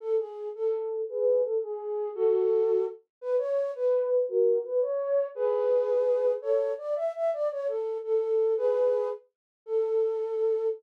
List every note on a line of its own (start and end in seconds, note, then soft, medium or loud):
0.00 0.16 A4 loud
0.18 0.49 G#4 medium
0.55 1.01 A4 medium
1.09 1.42 G#4 loud
1.09 1.42 B4 loud
1.44 1.58 A4 medium
1.63 2.09 G#4 medium
2.15 2.85 F#4 loud
2.15 2.85 A4 loud
3.21 3.36 B4 loud
3.38 3.71 C#5 loud
3.75 4.26 B4 loud
4.28 4.59 F#4 loud
4.28 4.59 A#4 loud
4.64 4.80 B4 loud
4.82 5.26 C#5 loud
5.35 6.32 G#4 loud
5.35 6.32 B4 loud
6.42 6.72 A4 medium
6.42 6.72 C#5 loud
6.78 6.94 D5 medium
6.96 7.12 E5 loud
7.15 7.30 E5 loud
7.33 7.48 D5 loud
7.51 7.67 C#5 loud
7.67 7.98 A4 medium
8.03 8.54 A4 loud
8.57 9.08 G#4 loud
8.57 9.08 B4 loud
9.66 10.67 A4 loud